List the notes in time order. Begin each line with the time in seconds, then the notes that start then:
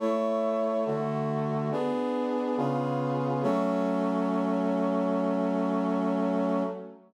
0.00 A3 E4 C#5
0.86 D3 A3 F#4
1.71 B3 D4 G#4
2.57 C#3 B3 F4 G#4
3.43 F#3 A3 C#4